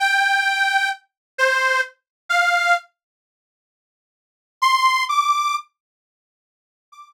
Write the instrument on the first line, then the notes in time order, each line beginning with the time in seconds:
accordion
0.00 G5
1.38 C5
2.29 F5
4.62 C6
5.09 D6
6.92 D6